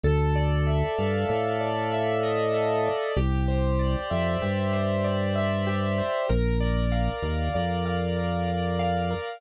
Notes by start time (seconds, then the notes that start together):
0.04 D2 A4
0.36 D5
0.67 E5
0.98 G2 F5
1.29 A2 A4
1.61 D5
1.92 E5
2.23 D#5
2.54 A4
2.86 D5
3.16 C2 G4
3.48 C5
3.79 D5
4.11 F2 E5
4.42 G2 G4
4.73 C5
5.04 D5
5.36 E5
5.67 G4
5.98 C5
6.29 A#1 A#4
6.60 D5
6.92 F5
7.23 D#2 A#4
7.54 F2 D5
7.86 F5
8.17 A#4
8.48 D5
8.79 F5
9.11 A#4